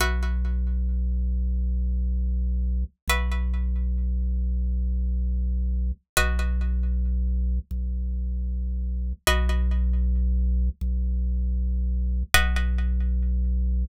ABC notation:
X:1
M:7/8
L:1/8
Q:1/4=136
K:B
V:1 name="Pizzicato Strings"
[FBe]7- | [FBe]7 | [FBe]7- | [FBe]7 |
[FBd]7- | [FBd]7 | [FBd]7- | [FBd]7 |
[FBd]7 |]
V:2 name="Drawbar Organ" clef=bass
B,,,7- | B,,,7 | B,,,7- | B,,,7 |
B,,,7 | B,,,7 | B,,,7 | B,,,7 |
B,,,7 |]